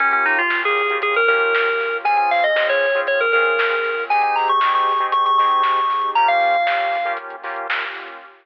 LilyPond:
<<
  \new Staff \with { instrumentName = "Electric Piano 2" } { \time 4/4 \key bes \minor \tempo 4 = 117 des'16 des'16 ees'16 f'8 aes'8. aes'16 bes'16 bes'4. | aes''16 aes''16 f''16 ees''8 des''8. des''16 bes'16 bes'4. | aes''16 aes''16 bes''16 des'''8 des'''8. des'''16 des'''16 des'''4. | bes''16 f''4.~ f''16 r2 | }
  \new Staff \with { instrumentName = "Lead 2 (sawtooth)" } { \time 4/4 \key bes \minor <bes des' f' g'>4 <bes des' f' g'>8. <bes des' f' g'>8. <bes des' f' g'>4. | <c' des' f' aes'>4 <c' des' f' aes'>8. <c' des' f' aes'>8. <c' des' f' aes'>4. | <c' ees' g' aes'>4 <c' ees' g' aes'>8. <c' ees' g' aes'>8. <c' ees' g' aes'>4. | <bes des' f' g'>4 <bes des' f' g'>8. <bes des' f' g'>8. <bes des' f' g'>4. | }
  \new Staff \with { instrumentName = "Synth Bass 2" } { \clef bass \time 4/4 \key bes \minor bes,,8. bes,,4 f,8. bes,,8. bes,,8. | des,8. des,4 aes,8. des,8. des,8. | aes,,8. aes,4 aes,,8. aes,8. aes,,8. | r1 | }
  \new Staff \with { instrumentName = "Pad 5 (bowed)" } { \time 4/4 \key bes \minor <bes des' f' g'>1 | <c' des' f' aes'>1 | <c' ees' g' aes'>1 | <bes des' f' g'>1 | }
  \new DrumStaff \with { instrumentName = "Drums" } \drummode { \time 4/4 <hh bd>16 hh16 hho16 hh16 <bd sn>16 hh16 hho16 hh16 <hh bd>16 hh16 hho16 hh16 <bd sn>16 hh16 <hho sn>16 hh16 | <hh bd>16 hh16 hho16 hh16 <bd sn>16 hh16 hho16 hh16 <hh bd>16 hh16 hho16 hh16 <bd sn>16 hh16 <hho sn>16 hho16 | <hh bd>16 hh16 hho16 hh16 <bd sn>16 hh16 hho16 hh16 <hh bd>16 hh16 hho16 hh16 <bd sn>16 hh16 <hho sn>16 hh16 | <hh bd>16 hh16 hho16 hh16 <bd sn>16 hh16 hho16 hh16 <hh bd>16 hh16 hho16 hh16 <bd sn>16 hh16 <hho sn>16 hh16 | }
>>